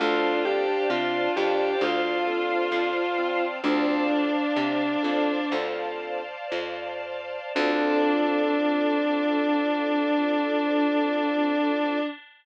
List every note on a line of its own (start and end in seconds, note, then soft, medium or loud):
0.00 0.78 D2 medium
0.00 0.64 C4 medium
0.00 0.40 D4 medium
0.00 0.64 D4 medium
0.00 0.38 F4 loud
0.00 0.64 F4 medium
0.00 0.64 A4 medium
0.00 3.60 C5 loud
0.00 3.60 D5 loud
0.00 3.60 F5 loud
0.00 3.60 A5 loud
0.45 1.76 D4 medium
0.45 0.82 G4 medium
0.90 1.29 C3 medium
0.90 1.26 F4 loud
1.36 1.75 F2 medium
1.36 1.77 G4 medium
1.81 2.58 D2 medium
1.81 3.36 F4 medium
2.27 2.91 C4 medium
2.27 2.91 D4 medium
2.27 2.91 F4 medium
2.27 2.91 A4 medium
2.72 3.49 F2 medium
3.18 3.60 C4 medium
3.64 4.42 D2 medium
3.64 4.08 C4 medium
3.64 4.29 C4 medium
3.64 5.44 D4 medium
3.64 4.29 D4 medium
3.64 4.29 F4 medium
3.64 4.29 A4 medium
3.64 7.51 C5 loud
3.64 7.51 D5 loud
3.64 7.51 F5 medium
3.64 7.51 A5 medium
4.10 5.31 D4 medium
4.56 4.97 C3 medium
5.03 5.45 F2 medium
5.03 5.37 C4 medium
5.03 5.37 D4 medium
5.03 5.37 F4 medium
5.03 5.37 A4 medium
5.52 6.36 D2 medium
5.52 6.22 C4 medium
5.52 6.22 D4 medium
5.52 6.22 F4 medium
5.52 6.22 A4 medium
6.52 7.39 F2 medium
7.55 11.99 D2 loud
7.55 11.98 C4 loud
7.55 11.99 C4 medium
7.55 11.98 D4 loud
7.55 11.99 D4 loud
7.55 11.98 F4 loud
7.55 11.99 F4 medium
7.55 11.98 A4 medium
7.55 11.99 A4 loud